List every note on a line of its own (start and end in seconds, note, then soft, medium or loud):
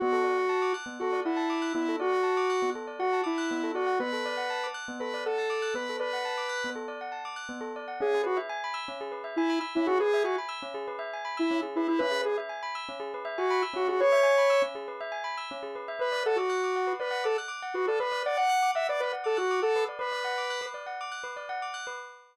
0.00 0.13 B3 medium
0.00 0.73 F#4 medium
0.12 0.24 A4 medium
0.24 0.35 D5 medium
0.38 0.49 F#5 medium
0.49 0.60 A5 medium
0.62 0.73 D6 medium
0.74 0.85 F#6 medium
0.86 0.97 B3 medium
1.00 1.20 F#4 medium
1.00 1.13 A4 medium
1.13 1.24 D5 medium
1.25 1.73 E4 medium
1.25 1.37 F#5 medium
1.37 1.48 A5 medium
1.50 1.61 D6 medium
1.62 1.73 F#6 medium
1.74 1.86 B3 medium
1.74 1.96 E4 medium
1.88 2.00 A4 medium
2.00 2.70 F#4 medium
2.00 2.11 D5 medium
2.13 2.24 F#5 medium
2.23 2.34 A5 medium
2.37 2.48 D6 medium
2.50 2.61 F#6 medium
2.62 2.74 B3 medium
2.75 2.86 A4 medium
2.87 2.99 D5 medium
2.99 3.21 F#4 medium
2.99 3.11 F#5 medium
3.13 3.24 A5 medium
3.24 3.72 E4 medium
3.24 3.35 D6 medium
3.38 3.49 F#6 medium
3.51 3.62 B3 medium
3.63 3.75 A4 medium
3.74 3.99 F#4 medium
3.74 3.87 D5 medium
3.87 3.98 F#5 medium
4.00 4.11 B3 medium
4.00 4.67 B4 medium
4.13 4.24 A4 medium
4.26 4.37 D5 medium
4.37 4.49 F#5 medium
4.50 4.61 A5 medium
4.64 4.75 D6 medium
4.74 4.86 F#6 medium
4.88 4.99 B3 medium
5.00 5.12 A4 medium
5.00 5.24 B4 medium
5.14 5.25 D5 medium
5.26 5.74 A4 medium
5.26 5.37 F#5 medium
5.38 5.49 A5 medium
5.50 5.61 D6 medium
5.62 5.74 F#6 medium
5.74 5.86 B3 medium
5.74 5.97 B4 medium
5.89 6.01 A4 medium
6.00 6.70 B4 medium
6.00 6.11 D5 medium
6.13 6.24 F#5 medium
6.25 6.36 A5 medium
6.38 6.49 D6 medium
6.49 6.61 F#6 medium
6.64 6.76 B3 medium
6.76 6.87 A4 medium
6.88 6.99 D5 medium
7.01 7.12 F#5 medium
7.12 7.23 A5 medium
7.25 7.36 D6 medium
7.36 7.47 F#6 medium
7.49 7.60 B3 medium
7.61 7.72 A4 medium
7.76 7.87 D5 medium
7.88 7.99 F#5 medium
8.00 8.12 C#4 medium
8.00 8.22 G#4 medium
8.14 8.25 G#4 medium
8.24 8.38 F#4 medium
8.24 8.35 B4 medium
8.37 8.48 E5 medium
8.49 8.61 G#5 medium
8.64 8.75 B5 medium
8.74 8.85 E6 medium
8.88 8.99 C#4 medium
9.01 9.12 G#4 medium
9.12 9.23 B4 medium
9.24 9.35 E5 medium
9.36 9.59 E4 medium
9.36 9.49 G#5 medium
9.50 9.61 B5 medium
9.61 9.72 E6 medium
9.75 9.88 C#4 medium
9.75 9.87 E4 medium
9.86 9.98 F#4 medium
9.86 9.99 G#4 medium
10.00 10.23 G#4 medium
10.00 10.11 B4 medium
10.14 10.25 E5 medium
10.24 10.36 F#4 medium
10.24 10.36 G#5 medium
10.38 10.49 B5 medium
10.49 10.60 E6 medium
10.62 10.74 C#4 medium
10.74 10.86 G#4 medium
10.88 10.99 B4 medium
10.99 11.10 E5 medium
11.13 11.25 G#5 medium
11.25 11.36 B5 medium
11.37 11.61 E4 medium
11.37 11.48 E6 medium
11.51 11.62 C#4 medium
11.62 11.74 G#4 medium
11.76 11.87 E4 medium
11.76 11.88 B4 medium
11.88 12.00 E4 medium
11.88 11.99 E5 medium
11.99 12.12 C#4 medium
11.99 12.21 B4 medium
12.11 12.22 G#4 medium
12.24 12.37 G#4 medium
12.24 12.35 B4 medium
12.38 12.49 E5 medium
12.49 12.61 G#5 medium
12.63 12.74 B5 medium
12.75 12.86 E6 medium
12.89 13.00 C#4 medium
13.00 13.11 G#4 medium
13.14 13.25 B4 medium
13.25 13.36 E5 medium
13.38 13.62 F#4 medium
13.38 13.49 G#5 medium
13.50 13.62 B5 medium
13.62 13.74 E6 medium
13.74 13.85 C#4 medium
13.74 13.88 F#4 medium
13.88 14.01 F#4 medium
13.88 13.99 G#4 medium
14.00 14.12 B4 medium
14.00 14.62 C#5 medium
14.12 14.24 E5 medium
14.23 14.34 G#5 medium
14.38 14.49 B5 medium
14.50 14.61 E6 medium
14.62 14.73 C#4 medium
14.75 14.86 G#4 medium
14.88 14.99 B4 medium
15.01 15.12 E5 medium
15.12 15.23 G#5 medium
15.24 15.35 B5 medium
15.38 15.49 E6 medium
15.51 15.62 C#4 medium
15.63 15.74 G#4 medium
15.75 15.87 B4 medium
15.88 15.99 E5 medium
15.99 16.11 B4 medium
15.99 16.23 B4 medium
16.12 16.23 D5 medium
16.26 16.38 A4 medium
16.26 16.37 F#5 medium
16.36 16.93 F#4 medium
16.36 16.49 D6 medium
16.50 16.61 F#6 medium
16.64 16.75 D6 medium
16.76 16.87 F#5 medium
16.87 16.98 B4 medium
17.00 17.24 B4 medium
17.00 17.11 D5 medium
17.11 17.22 F#5 medium
17.24 17.37 A4 medium
17.24 17.35 D6 medium
17.38 17.49 F#6 medium
17.48 17.59 D6 medium
17.62 17.74 F#5 medium
17.74 17.86 F#4 medium
17.74 17.86 B4 medium
17.87 17.99 A4 medium
17.87 18.00 D5 medium
18.00 18.23 B4 medium
18.00 18.11 B4 medium
18.12 18.23 D5 medium
18.26 18.38 D5 medium
18.26 18.37 F#5 medium
18.37 18.71 F#5 medium
18.37 18.48 D6 medium
18.49 18.61 F#6 medium
18.63 18.74 D6 medium
18.75 18.87 E5 medium
18.75 18.86 F#5 medium
18.89 19.00 B4 medium
18.89 19.01 D5 medium
19.00 19.12 B4 medium
19.00 19.12 D5 medium
19.13 19.24 F#5 medium
19.24 19.38 A4 medium
19.24 19.35 D6 medium
19.37 19.60 F#4 medium
19.37 19.48 F#6 medium
19.51 19.62 D6 medium
19.62 19.84 A4 medium
19.62 19.74 F#5 medium
19.76 19.87 B4 medium
19.89 20.00 D5 medium
19.99 20.10 B4 medium
19.99 20.66 B4 medium
20.12 20.23 D5 medium
20.24 20.36 F#5 medium
20.38 20.49 D6 medium
20.50 20.61 F#6 medium
20.61 20.73 B4 medium
20.74 20.85 D5 medium
20.86 20.98 F#5 medium
21.01 21.12 D6 medium
21.12 21.23 F#6 medium
21.24 21.35 B4 medium
21.36 21.48 D5 medium
21.49 21.60 F#5 medium
21.62 21.74 D6 medium
21.74 21.85 F#6 medium
21.87 21.98 B4 medium